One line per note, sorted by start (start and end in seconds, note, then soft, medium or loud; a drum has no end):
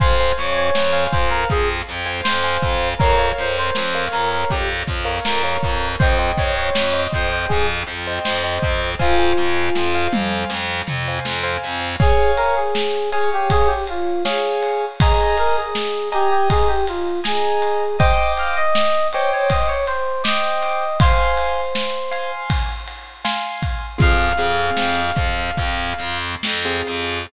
0.00 0.32 F2 loud
0.00 0.15 C5 loud
0.00 0.33 C5 medium
0.00 0.15 F5 medium
0.00 0.15 G#5 loud
0.00 kick loud
0.00 closed hi-hat loud
0.20 0.80 C5 medium
0.20 0.80 F5 medium
0.20 0.80 G#5 medium
0.38 0.70 F2 medium
0.38 0.55 C#5 medium
0.38 closed hi-hat medium
0.56 1.04 C#5 medium
0.75 1.07 F2 medium
0.75 snare loud
0.93 1.53 C5 medium
0.93 1.53 F5 loud
0.93 1.53 G#5 medium
1.12 1.44 F2 medium
1.12 1.29 C5 medium
1.12 kick loud
1.12 closed hi-hat medium
1.30 1.47 A#4 medium
1.50 1.82 F2 medium
1.50 1.68 G#4 medium
1.50 kick loud
1.50 closed hi-hat loud
1.87 2.20 F2 medium
1.87 closed hi-hat medium
2.06 2.36 C5 medium
2.06 2.36 F5 medium
2.06 2.36 G#5 medium
2.24 2.57 F2 medium
2.24 2.89 C5 medium
2.24 snare loud
2.44 2.89 C5 medium
2.44 2.89 F5 medium
2.44 2.89 G#5 medium
2.62 2.94 F2 medium
2.62 kick medium
2.62 closed hi-hat medium
2.98 3.32 F2 loud
2.98 3.29 A#4 medium
2.98 3.16 A#4 loud
2.98 3.16 C#5 loud
2.98 3.16 F5 loud
2.98 kick loud
2.98 closed hi-hat loud
3.19 3.79 A#4 medium
3.19 3.79 C#5 medium
3.19 3.79 F5 medium
3.38 3.70 F2 medium
3.38 3.57 C5 medium
3.38 closed hi-hat medium
3.58 4.05 C5 medium
3.75 4.08 F2 medium
3.75 snare loud
3.95 4.55 A#4 medium
3.95 4.55 C#5 medium
3.95 4.55 F5 medium
4.12 4.44 F2 medium
4.12 4.30 A#4 medium
4.12 closed hi-hat medium
4.32 4.50 A#4 medium
4.50 4.83 F2 medium
4.50 4.68 G4 medium
4.50 kick medium
4.50 closed hi-hat loud
4.87 5.19 F2 medium
4.87 kick medium
4.87 closed hi-hat medium
5.05 5.35 A#4 medium
5.05 5.35 C#5 medium
5.05 5.35 F5 medium
5.24 5.57 F2 medium
5.24 5.88 A#4 medium
5.24 snare loud
5.43 5.88 A#4 medium
5.43 5.88 C#5 medium
5.43 5.88 F5 medium
5.62 5.95 F2 medium
5.62 kick medium
5.62 closed hi-hat medium
5.99 6.32 F2 loud
5.99 6.30 C5 medium
5.99 6.17 C5 medium
5.99 6.17 D#5 loud
5.99 6.17 G5 medium
5.99 kick loud
5.99 closed hi-hat loud
6.19 6.79 C5 medium
6.19 6.79 D#5 medium
6.19 6.79 G5 medium
6.38 6.69 F2 medium
6.38 6.55 C#5 soft
6.38 kick medium
6.38 closed hi-hat medium
6.56 7.02 C#5 medium
6.75 7.07 F2 medium
6.75 snare loud
6.94 7.54 C5 medium
6.94 7.54 D#5 medium
6.94 7.54 G5 medium
7.12 7.45 F2 medium
7.12 7.30 C5 medium
7.12 kick medium
7.12 closed hi-hat medium
7.30 7.48 C5 medium
7.48 7.83 F2 medium
7.48 7.66 G#4 medium
7.48 kick medium
7.48 closed hi-hat loud
7.87 8.19 F2 medium
7.87 closed hi-hat medium
8.07 8.37 C5 medium
8.07 8.37 D#5 medium
8.07 8.37 G5 medium
8.24 8.58 F2 medium
8.24 8.91 C5 medium
8.24 snare loud
8.43 8.88 C5 medium
8.43 8.88 D#5 medium
8.43 8.88 G5 medium
8.62 8.95 F2 medium
8.62 kick loud
8.62 closed hi-hat medium
8.99 9.32 F2 loud
8.99 10.07 F4 medium
8.99 9.14 C5 loud
8.99 9.14 F5 medium
8.99 9.14 G#5 loud
8.99 kick medium
9.19 9.79 C5 medium
9.19 9.79 F5 medium
9.19 9.79 G#5 medium
9.37 9.69 F2 medium
9.75 10.07 F2 medium
9.75 snare medium
9.95 10.55 C5 medium
9.95 10.55 F5 medium
9.95 10.55 G#5 medium
10.12 10.44 F2 medium
10.12 mid tom loud
10.50 10.81 F2 medium
10.50 snare medium
10.87 11.19 F2 medium
10.87 floor tom medium
11.08 11.38 C5 medium
11.08 11.38 F5 medium
11.08 11.38 G#5 medium
11.25 11.57 F2 medium
11.25 snare loud
11.43 11.88 C5 medium
11.43 11.88 F5 medium
11.43 11.88 G#5 medium
11.64 11.95 F2 medium
12.00 12.31 G#4 medium
12.00 12.60 C#5 loud
12.00 12.60 F5 loud
12.00 12.60 G#5 loud
12.00 kick loud
12.00 crash loud
12.37 12.55 A#4 medium
12.37 ride medium
12.56 13.10 G#4 medium
12.75 snare loud
13.12 13.30 G#4 medium
13.12 13.72 C#5 loud
13.12 13.72 F5 medium
13.12 13.72 G#5 loud
13.12 ride medium
13.33 13.51 G4 medium
13.50 13.68 G#4 medium
13.50 kick loud
13.50 ride loud
13.67 13.85 G4 medium
13.87 14.23 F4 medium
13.87 ride medium
14.25 14.85 G#4 medium
14.25 14.85 C#5 loud
14.25 14.85 F5 medium
14.25 14.85 G#5 medium
14.25 snare loud
14.63 ride medium
15.00 15.36 G#4 medium
15.00 15.62 D#5 loud
15.00 15.62 G#5 loud
15.00 15.62 A#5 loud
15.00 kick loud
15.00 ride loud
15.38 15.56 A#4 medium
15.38 ride medium
15.57 16.09 G#4 medium
15.75 snare loud
16.12 16.30 G4 medium
16.12 16.72 D#5 loud
16.12 16.72 G#5 loud
16.12 16.72 A#5 medium
16.12 ride medium
16.30 16.48 G4 medium
16.50 16.68 G#4 medium
16.50 kick loud
16.50 ride loud
16.68 16.85 G4 medium
16.87 17.20 F4 medium
16.87 ride medium
17.24 17.97 G#4 medium
17.24 17.84 D#5 medium
17.24 17.84 G#5 loud
17.24 17.84 A#5 medium
17.24 snare loud
17.62 ride medium
17.98 18.60 C5 loud
17.98 18.32 D#5 medium
17.98 18.60 D#5 loud
17.98 18.60 G5 loud
17.98 18.60 D6 loud
17.98 kick loud
17.98 ride loud
18.37 18.56 F5 medium
18.37 ride medium
18.56 19.07 D#5 medium
18.75 snare loud
19.13 19.74 C5 loud
19.13 19.31 C#5 medium
19.13 19.74 D#5 medium
19.13 19.74 G5 loud
19.13 19.74 D6 medium
19.13 ride medium
19.32 19.50 C#5 medium
19.50 19.68 D#5 medium
19.50 kick loud
19.50 ride loud
19.67 19.85 C#5 medium
19.86 20.23 C5 medium
19.86 ride medium
20.24 20.84 C5 loud
20.24 20.84 D#5 medium
20.24 20.98 D#5 medium
20.24 20.84 G5 loud
20.24 20.84 D6 loud
20.24 snare loud
20.63 ride medium
21.00 22.31 C5 medium
21.00 21.61 F5 loud
21.00 21.61 G#5 loud
21.00 21.61 C6 loud
21.00 kick loud
21.00 ride loud
21.38 ride medium
21.75 snare loud
22.11 22.71 F5 medium
22.11 22.71 G#5 medium
22.11 22.71 C6 loud
22.11 ride medium
22.50 kick loud
22.50 ride loud
22.88 ride medium
23.25 23.85 F5 medium
23.25 23.85 G#5 loud
23.25 23.85 C6 medium
23.25 snare loud
23.62 kick medium
23.62 ride medium
23.98 24.32 F2 loud
23.98 24.28 C4 medium
23.98 24.28 F4 medium
23.98 24.28 G#4 loud
23.98 26.18 F5 medium
23.98 kick loud
23.98 closed hi-hat loud
24.37 24.70 F2 medium
24.37 25.01 C4 medium
24.37 25.01 F4 medium
24.37 25.01 G#4 medium
24.37 closed hi-hat medium
24.77 25.11 F2 medium
24.77 snare loud
25.16 25.50 F2 medium
25.16 kick loud
25.16 closed hi-hat medium
25.57 25.93 F2 medium
25.57 kick medium
25.57 closed hi-hat loud
25.98 26.35 F2 loud
25.98 closed hi-hat medium
26.43 26.81 F2 medium
26.43 snare loud
26.65 27.19 C4 medium
26.65 27.19 F4 medium
26.65 27.19 G#4 medium
26.87 27.26 F2 medium
26.87 closed hi-hat medium